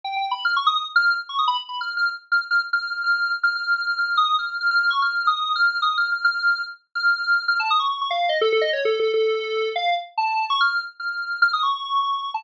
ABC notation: X:1
M:2/4
L:1/16
Q:1/4=145
K:none
V:1 name="Lead 1 (square)"
(3g2 g2 b2 f' _d' _e' e' | z f'2 z _d' _e' b z | (3b2 f'2 f'2 z2 f' z | f' z f'2 f' f'3 |
z f' f'2 f' f' f'2 | _e'2 f'2 f' f'2 _d' | (3f'4 _e'4 f'4 | (3_e'2 f'2 f'2 f'4 |
z3 f'5 | f' a _e' _d'2 d' f2 | _e A A e (3_d2 A2 A2 | A6 f2 |
z2 a3 _d' f'2 | z2 f'4 f' _e' | _d'4 d'3 a |]